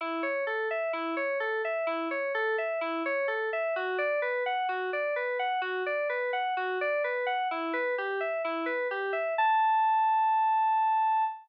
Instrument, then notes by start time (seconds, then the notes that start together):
electric piano 2
0.01 E4
0.23 C#5
0.47 A4
0.71 E5
0.93 E4
1.17 C#5
1.40 A4
1.65 E5
1.87 E4
2.11 C#5
2.35 A4
2.58 E5
2.81 E4
3.06 C#5
3.28 A4
3.53 E5
3.76 F#4
3.98 D5
4.22 B4
4.46 F#5
4.69 F#4
4.93 D5
5.16 B4
5.39 F#5
5.62 F#4
5.86 D5
6.09 B4
6.33 F#5
6.57 F#4
6.81 D5
7.04 B4
7.26 F#5
7.51 E4
7.73 B4
7.98 G4
8.21 E5
8.45 E4
8.66 B4
8.91 G4
9.13 E5
9.38 A5